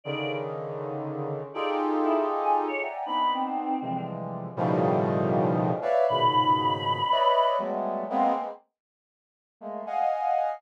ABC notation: X:1
M:6/8
L:1/16
Q:3/8=79
K:none
V:1 name="Brass Section"
[_D,=D,_E,]12 | [_EFG_A=A]10 [d=e_g=g_a_b]2 | [B,CD_E]6 [C,D,=E,F,G,_A,]6 | [A,,B,,_D,_E,F,G,]10 [B_d=d=ef]2 |
[_A,,_B,,=B,,_D,_E,]8 [B_d=d_e=e]4 | [_G,=G,_A,=A,B,]4 [_A,_B,=B,C]2 z6 | z4 [_A,=A,_B,]2 [_ef_g_a]6 |]
V:2 name="Choir Aahs"
d2 z10 | d z3 E z2 _a z _d z2 | b2 C6 z4 | z12 |
b12 | z12 | z12 |]